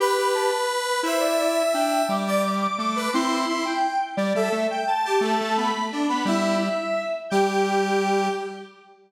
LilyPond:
<<
  \new Staff \with { instrumentName = "Lead 1 (square)" } { \time 6/8 \key g \major \tempo 4. = 115 b''8 b''8 a''8 b'4 b'8 | c''8 d''8 d''8 e''8 g''4 | d'''8 d'''8 d'''8 d'''8 d'''4 | c'''4. g''4 r8 |
d''8 e''8 e''8 g''8 a''4 | a''4 b''4 r8 b''8 | e''2~ e''8 r8 | g''2. | }
  \new Staff \with { instrumentName = "Lead 1 (square)" } { \time 6/8 \key g \major b'2. | e''2. | r8 d''8 r4. b'8 | e'4 e'8 r4. |
r8 a'8 r4. g'8 | a4. r8 d'8 b8 | e'4 r2 | g'2. | }
  \new Staff \with { instrumentName = "Lead 1 (square)" } { \time 6/8 \key g \major g'8 g'8 g'8 r4. | e'2 d'4 | g2 a4 | c'4 r2 |
g8 g8 a8 r4. | a8 a8 b8 r4. | g4. r4. | g2. | }
>>